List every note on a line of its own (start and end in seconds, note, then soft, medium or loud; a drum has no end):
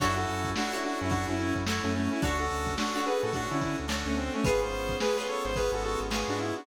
0.00 0.26 F#2 loud
0.00 0.52 C#4 medium
0.00 0.16 D4 loud
0.00 0.52 E4 medium
0.00 0.47 E4 medium
0.00 0.16 F#4 loud
0.00 0.52 F#4 medium
0.00 0.47 F#4 medium
0.00 0.52 A4 medium
0.00 0.47 A4 medium
0.00 0.47 C#5 medium
0.00 kick loud
0.00 crash loud
0.16 0.50 F#4 medium
0.16 0.50 A4 loud
0.16 closed hi-hat medium
0.28 0.54 F#2 medium
0.28 closed hi-hat medium
0.44 kick medium
0.44 closed hi-hat medium
0.56 1.07 C#4 medium
0.56 0.72 D4 loud
0.56 1.07 E4 medium
0.56 0.72 F#4 loud
0.56 1.07 F#4 medium
0.56 1.07 A4 medium
0.56 snare loud
0.72 0.83 D4 medium
0.72 1.14 E4 medium
0.72 0.83 F#4 loud
0.72 1.14 F#4 medium
0.72 1.14 A4 medium
0.72 1.14 C#5 medium
0.72 closed hi-hat medium
0.83 0.99 D4 loud
0.83 0.99 F#4 loud
0.83 snare soft
0.83 closed hi-hat medium
1.00 1.26 F#2 medium
1.00 1.11 C#4 loud
1.00 1.11 E4 loud
1.00 closed hi-hat medium
1.09 1.60 C#4 medium
1.09 1.26 D4 loud
1.09 1.60 E4 medium
1.09 1.60 F#4 medium
1.09 1.26 F#4 loud
1.09 1.60 A4 medium
1.09 kick medium
1.09 closed hi-hat medium
1.28 1.53 F#2 medium
1.28 1.38 C#4 loud
1.28 1.38 E4 loud
1.28 closed hi-hat medium
1.38 1.54 C#4 loud
1.38 1.54 E4 loud
1.38 closed hi-hat medium
1.55 1.80 F#2 medium
1.55 kick medium
1.55 closed hi-hat medium
1.66 2.19 C#4 medium
1.66 2.19 E4 medium
1.66 2.13 E4 medium
1.66 2.19 F#4 medium
1.66 2.13 F#4 medium
1.66 2.19 A4 medium
1.66 2.13 A4 medium
1.66 2.13 C#5 medium
1.66 snare loud
1.83 2.09 F#2 medium
1.83 1.93 A3 medium
1.83 1.93 C#4 loud
1.83 closed hi-hat medium
1.94 2.10 A3 loud
1.94 2.10 C#4 loud
1.94 closed hi-hat medium
2.11 2.22 C#4 loud
2.11 2.22 E4 loud
2.11 snare soft
2.11 closed hi-hat medium
2.22 2.49 D2 loud
2.22 2.74 C#4 medium
2.22 2.38 D4 loud
2.22 2.74 D4 medium
2.22 2.38 F#4 loud
2.22 2.74 F#4 medium
2.22 2.69 F#4 medium
2.22 2.74 A4 medium
2.22 2.69 A4 medium
2.22 2.69 C#5 medium
2.22 2.69 D5 loud
2.22 kick loud
2.22 closed hi-hat loud
2.39 2.74 F#4 medium
2.39 2.74 A4 loud
2.39 closed hi-hat medium
2.50 2.76 D2 medium
2.50 closed hi-hat medium
2.66 kick medium
2.66 closed hi-hat medium
2.77 3.28 C#4 medium
2.77 3.28 D4 medium
2.77 2.94 D4 medium
2.77 3.28 F#4 medium
2.77 2.94 F#4 loud
2.77 3.28 A4 medium
2.77 snare loud
2.94 3.05 D4 loud
2.94 3.05 F#4 loud
2.94 3.37 F#4 medium
2.94 3.37 A4 medium
2.94 3.37 C#5 medium
2.94 3.37 D5 medium
2.94 snare soft
2.94 closed hi-hat medium
3.06 3.21 G#4 loud
3.06 3.21 B4 loud
3.06 closed hi-hat medium
3.22 3.48 A2 medium
3.22 3.33 F#4 loud
3.22 3.33 A4 loud
3.22 closed hi-hat medium
3.33 3.85 C#4 medium
3.33 3.49 D4 medium
3.33 3.85 D4 medium
3.33 3.49 F#4 loud
3.33 3.85 F#4 medium
3.33 3.85 A4 medium
3.33 kick medium
3.33 closed hi-hat loud
3.50 3.76 D3 loud
3.50 3.60 C#4 medium
3.50 3.60 E4 loud
3.50 closed hi-hat medium
3.61 3.77 C#4 medium
3.61 3.77 E4 medium
3.61 kick medium
3.61 closed hi-hat medium
3.78 4.04 D2 medium
3.78 closed hi-hat medium
3.88 4.39 C#4 medium
3.88 4.39 D4 medium
3.88 4.39 F#4 medium
3.88 4.39 A4 medium
3.88 4.36 A4 medium
3.88 4.36 C#5 medium
3.88 4.36 D5 medium
3.88 snare loud
3.92 4.36 F#4 medium
4.06 4.30 D2 medium
4.06 4.16 A3 medium
4.06 4.16 C#4 loud
4.06 closed hi-hat medium
4.17 4.33 C4 loud
4.17 closed hi-hat medium
4.34 4.44 A3 loud
4.34 4.44 C#4 loud
4.34 closed hi-hat medium
4.44 4.72 G#1 loud
4.44 4.95 B3 medium
4.44 4.95 C#4 medium
4.44 4.95 F4 medium
4.44 4.91 F4 medium
4.44 4.95 G#4 medium
4.44 4.61 G#4 loud
4.44 4.91 G#4 loud
4.44 4.61 B4 loud
4.44 4.91 B4 medium
4.44 4.91 C#5 medium
4.44 kick loud
4.44 closed hi-hat loud
4.61 4.97 C5 loud
4.61 snare soft
4.61 closed hi-hat medium
4.72 4.98 G#1 medium
4.72 closed hi-hat medium
4.89 kick medium
4.89 closed hi-hat medium
5.00 5.51 B3 medium
5.00 5.51 C#4 medium
5.00 5.51 F4 medium
5.00 5.51 G#4 medium
5.00 5.16 G#4 loud
5.00 5.16 B4 loud
5.00 snare loud
5.17 5.59 F4 medium
5.17 5.27 G#4 loud
5.17 5.59 G#4 medium
5.17 5.27 B4 loud
5.17 5.59 B4 medium
5.17 5.59 C#5 medium
5.17 snare medium
5.28 5.44 A4 medium
5.28 5.44 C#5 loud
5.28 closed hi-hat medium
5.44 5.70 G#1 medium
5.44 5.55 C5 loud
5.44 snare soft
5.44 closed hi-hat medium
5.56 6.07 B3 medium
5.56 6.07 C#4 medium
5.56 6.07 F4 medium
5.56 5.71 G#4 loud
5.56 6.07 G#4 medium
5.56 5.71 B4 loud
5.56 kick medium
5.56 closed hi-hat medium
5.72 5.96 G#1 medium
5.72 5.83 F#4 medium
5.72 5.83 A4 loud
5.72 closed hi-hat medium
5.83 6.00 F#4 loud
5.83 6.00 A4 loud
5.83 closed hi-hat medium
6.00 6.25 G#1 medium
6.00 closed hi-hat medium
6.10 6.61 B3 medium
6.10 6.61 C#4 medium
6.10 6.61 F4 medium
6.10 6.61 G#4 medium
6.10 6.58 G#4 medium
6.10 6.58 B4 medium
6.10 6.58 C#5 medium
6.10 snare loud
6.14 6.58 F4 medium
6.28 6.53 G#2 medium
6.28 6.39 D4 medium
6.28 6.39 F#4 loud
6.28 closed hi-hat medium
6.39 6.55 E4 loud
6.39 closed hi-hat medium
6.56 6.66 D4 medium
6.56 6.66 F#4 loud
6.56 closed hi-hat medium